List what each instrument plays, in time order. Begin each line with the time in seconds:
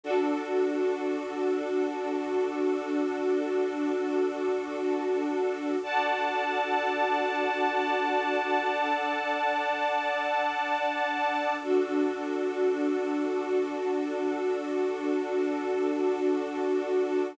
0.03 pad 5 (bowed) D4 F#4 A4, string ensemble 1 D4 F#4 A4
5.82 pad 5 (bowed) D4 F#4 A4, string ensemble 1 D5 F#5 A5
8.70 pad 5 (bowed) D4 A4 D5
11.60 pad 5 (bowed) D4 F#4 A4, string ensemble 1 D4 F#4 A4